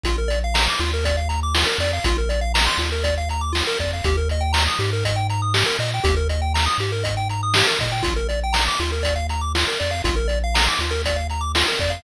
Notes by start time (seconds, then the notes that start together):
0.03 A#1 F4, kick, closed hi-hat
0.18 A#4
0.28 D5, closed hi-hat
0.44 F5
0.54 A#5, snare
0.69 D6
0.79 D#2 F4, closed hi-hat
0.93 A#4
1.04 D5, kick, closed hi-hat
1.17 F5
1.29 A#5, closed hi-hat
1.43 D6
1.54 F4, snare
1.66 A#4
1.78 F2 D5, closed hi-hat
1.93 F5
2.04 A#1 F4, kick, closed hi-hat
2.18 A#4
2.29 D5, closed hi-hat
2.41 F5
2.54 A#5, snare
2.67 C6
2.78 D#2 F4, closed hi-hat
2.92 A#4
3.04 D5, kick, closed hi-hat
3.17 F5
3.29 A#5, closed hi-hat
3.41 D6
3.53 F4, snare
3.67 A#4
3.79 F2 D5, kick, closed hi-hat
3.93 F5
4.04 D#2 G4, kick, closed hi-hat
4.17 A#4
4.29 D#5, closed hi-hat
4.41 G5
4.53 A#5, snare
4.67 D#6
4.79 G#2 G4, closed hi-hat
4.93 A#4
5.04 D#5, kick, closed hi-hat
5.16 G5
5.29 A#5, closed hi-hat
5.42 D#6
5.54 G4, snare
5.66 A#4
5.79 A#2 D#5, closed hi-hat
5.94 G5
6.04 D#2 G4, kick, closed hi-hat
6.17 A#4
6.29 D#5, closed hi-hat
6.42 G5
6.54 A#5, snare
6.66 D#6
6.78 G#2 G4, closed hi-hat
6.92 A#4
7.04 D#5, kick, closed hi-hat
7.17 G5
7.29 A#5, closed hi-hat
7.43 D#6
7.54 G4, snare
7.67 A#4
7.79 A#2 D#5, kick, closed hi-hat
7.92 G5
8.03 A#1 F4, kick, closed hi-hat
8.16 A#4
8.29 D5, closed hi-hat
8.43 G5
8.53 A#5, snare
8.68 D6
8.79 D#2 F4, closed hi-hat
8.92 A#4
9.03 D5, kick, closed hi-hat
9.16 F5
9.29 A#5, closed hi-hat
9.41 D6
9.55 F4, snare
9.68 A#4
9.80 F2 D5, closed hi-hat
9.91 F5
10.04 A#1 F4, kick, closed hi-hat
10.16 A#4
10.28 D5, closed hi-hat
10.44 F5
10.54 A#5, snare
10.68 D6
10.79 D#2 F4, closed hi-hat
10.91 A#4
11.04 D5, kick, closed hi-hat
11.16 F5
11.30 A#5, closed hi-hat
11.41 D6
11.55 F4, snare
11.68 A#4
11.79 F2 D5, kick, closed hi-hat
11.90 F5